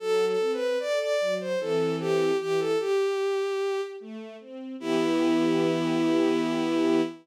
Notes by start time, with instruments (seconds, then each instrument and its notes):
0.00 string ensemble 1 F#3, violin A4
0.27 violin A4
0.40 string ensemble 1 C4
0.53 violin B4
0.80 string ensemble 1 A4, violin D5
1.00 violin D5
1.20 string ensemble 1 F#3
1.40 violin C5
1.59 string ensemble 1 E3 C4 A4, violin A4
2.00 violin G4
2.40 string ensemble 1 E3, violin G4
2.59 violin A4
2.80 violin G4, string ensemble 1 G4
3.20 string ensemble 1 G4
3.60 string ensemble 1 G4
4.00 string ensemble 1 A3
4.40 string ensemble 1 C4
4.79 string ensemble 1 E3 B3 G4, violin E4